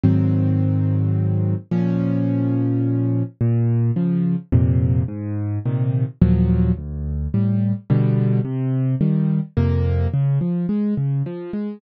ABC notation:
X:1
M:3/4
L:1/8
Q:1/4=107
K:Db
V:1 name="Acoustic Grand Piano"
[A,,E,G,C]6 | [B,,F,D]6 | [K:Bbm] B,,2 [D,F,]2 [F,,B,,C,]2 | A,,2 [B,,C,E,]2 [E,,B,,F,G,]2 |
=D,,2 [=A,,=G,]2 [=B,,=D,G,]2 | C,2 [E,=G,]2 [F,,C,B,]2 | [K:Db] D, F, A, D, F, A, |]